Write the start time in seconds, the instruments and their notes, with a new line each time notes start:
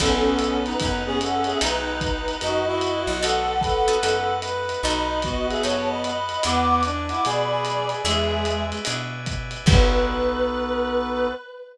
0.00 electric bass (finger) B1, acoustic guitar (steel) B3 D#4 F#4 A4, brass section B3, clarinet C#4 A4, drawbar organ B4 D#5 F#5 A5, kick, crash, ride
0.39 hi-hat pedal, ride
0.65 clarinet D#4 B4, ride
0.80 electric bass (finger) F#2, brass section B3, clarinet D#4 B4, kick, ride
1.06 clarinet B3 G#4, brass section C#4
1.21 clarinet A4 F#5, hi-hat pedal, ride
1.44 clarinet G#4 E5, ride
1.61 electric bass (finger) B1, acoustic guitar (steel) B3 D#4 F#4 A4, clarinet D#4 B4, brass section D#4, drawbar organ B4 D#5 F#5 A5, ride
2.01 kick, hi-hat pedal, ride
2.28 ride
2.41 electric bass (finger) F#2, brass section D#4, clarinet F#4 D#5, ride
2.66 brass section E4, clarinet F#4 D#5
2.81 hi-hat pedal, ride
3.07 electric bass (finger) B1, ride
3.22 acoustic guitar (steel) B3 D#4 F#4 A4, brass section A4, clarinet A4 F#5, drawbar organ B4 D#5 F#5 A5, ride
3.61 clarinet A4 F#5, brass section B4, kick, hi-hat pedal, ride
3.88 acoustic guitar (steel) B3 D#4 F#4 A4, ride
4.03 electric bass (finger) F#2, acoustic guitar (steel) B3 D#4 F#4 A4, ride
4.42 brass section B4, hi-hat pedal, ride
4.69 ride
4.83 electric bass (finger) B1, acoustic guitar (steel) B3 D#4 F#4 A4, brass section D#4, drawbar organ B4 D#5 F#5 A5, clarinet D#5 B5, ride
5.22 brass section B3, clarinet F#4 D#5, kick, hi-hat pedal, ride
5.49 clarinet G#4 E5, ride
5.63 electric bass (finger) F#2, acoustic guitar (steel) B3 D#4 F#4 A4, clarinet C#5 A5, ride
5.89 clarinet D#5 B5
6.04 clarinet D#5 B5, hi-hat pedal, ride
6.29 ride
6.43 electric bass (finger) E2, acoustic guitar (steel) B3 D4 E4 G#4, brass section B3, drawbar organ B4 D5 E5 G#5, clarinet F#5 D6, ride
6.69 clarinet F#5 D6
6.83 brass section D4, hi-hat pedal, ride
7.09 brass section E4, clarinet F#5 D6, ride
7.25 electric bass (finger) B2, brass section G#4, clarinet D5 B5, ride
7.50 brass section G#4
7.65 hi-hat pedal, ride
7.89 ride
8.05 electric bass (finger) E2, brass section G#3, acoustic guitar (steel) B3 D4 E4 G#4, clarinet G#4 E5, drawbar organ B4 D5 E5 G#5, ride
8.45 hi-hat pedal, ride
8.72 ride
8.85 electric bass (finger) B2, acoustic guitar (steel) B3 D4 E4 G#4, ride
9.26 kick, hi-hat pedal, ride
9.51 ride
9.66 electric bass (finger) B1, acoustic guitar (steel) B3 D#4 F#4 A4, brass section B3, drawbar organ B3 D#4 F#4 A4, clarinet B4, kick, crash